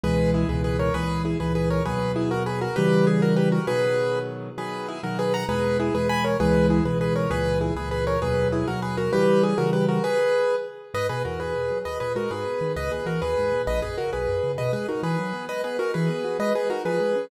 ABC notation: X:1
M:6/8
L:1/8
Q:3/8=132
K:B
V:1 name="Acoustic Grand Piano"
[GB]2 [EG] [GB] [GB] [Ac] | [GB]2 [EG] [GB] [GB] [Ac] | [GB]2 [EG] [FA] [GB] [FA] | [=GB]2 ^G [FA] [=GB] [FA] |
[GB]4 z2 | [GB]2 [EG] [FA] [GB] [fa] | [GB]2 [EG] [GB] [gb] [Ac] | [GB]2 [EG] [GB] [GB] [Ac] |
[GB]2 [EG] [GB] [GB] [Ac] | [GB]2 [EG] [FA] [GB] [FA] | [=GB]2 ^G [FA] [=GB] [FA] | [GB]4 z2 |
[K:G#m] [Bd] [GB] [FA] [GB]3 | [Bd] [GB] [FA] [GB]3 | [Bd] [GB] [FA] [GB]3 | [Bd] [GB] [FA] [GB]3 |
[Bd] [GB] [FA] [GB]3 | [Bd] [GB] [FA] [GB]3 | [Bd] [GB] [FA] [GB]3 |]
V:2 name="Acoustic Grand Piano"
[C,,B,,E,G,]3 [C,,B,,E,G,]3 | [C,,A,,E,]3 [C,,A,,E,]3 | [D,,B,,F,]6 | [C,E,=G,]6 |
[B,,D,F,]6 | [B,,D,F,]3 [B,,D,F,]3 | [E,,B,,G,]3 [E,,B,,G,]3 | [C,,B,,E,G,]3 [C,,B,,E,G,]3 |
[C,,A,,E,]3 [C,,A,,E,]3 | [D,,B,,F,]3 [D,,B,,F,]3 | [C,E,=G,]3 [C,E,G,]3 | z6 |
[K:G#m] G,, B,, E,,2 B,, F, | D,, A,, G, G,, B,, D, | C,, A,, E, D,, G,, A,, | A,,, F,, C, B,,, F,, C, |
B,, G, D E, F, B, | G, B, D E, B, F | G, B, D ^E, G, C |]